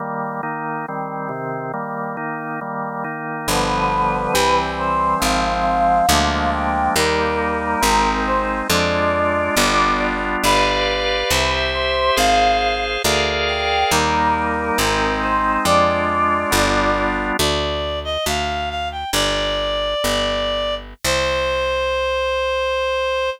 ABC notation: X:1
M:2/2
L:1/8
Q:1/2=69
K:Cm
V:1 name="Choir Aahs"
z8 | z8 | =B6 c2 | f6 g2 |
B6 c2 | d7 z | =B6 c2 | f3 z3 g2 |
B6 c2 | d7 z | z8 | "^rit." z8 |
z8 |]
V:2 name="Clarinet"
z8 | z8 | z8 | z8 |
z8 | z8 | z8 | z8 |
z8 | z8 | d3 e f2 f g | "^rit." d7 z |
c8 |]
V:3 name="Drawbar Organ"
[E,G,B,]2 [E,B,E]2 [E,G,C]2 [C,E,C]2 | [E,G,B,]2 [E,B,E]2 [E,G,B,]2 [E,B,E]2 | [D,F,G,=B,]4 [=E,G,C]4 | [F,A,C]4 [F,A,B,D]4 |
[G,B,E]4 [A,CE]4 | [A,DF]4 [G,=B,DF]4 | [G=Bdf]4 [Gc=e]4 | [Acf]4 [ABdf]4 |
[G,B,E]4 [A,CE]4 | [A,DF]4 [G,=B,DF]4 | z8 | "^rit." z8 |
z8 |]
V:4 name="Electric Bass (finger)" clef=bass
z8 | z8 | G,,,4 C,,4 | A,,,4 D,,4 |
E,,4 A,,,4 | F,,4 G,,,4 | G,,,4 C,,4 | A,,,4 D,,4 |
E,,4 A,,,4 | F,,4 G,,,4 | D,,4 D,,4 | "^rit." G,,,4 G,,,4 |
C,,8 |]